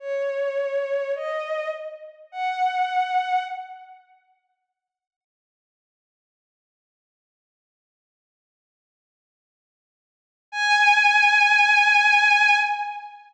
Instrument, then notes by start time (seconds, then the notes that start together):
violin
0.00 C#5
1.15 D#5
2.32 F#5
10.52 G#5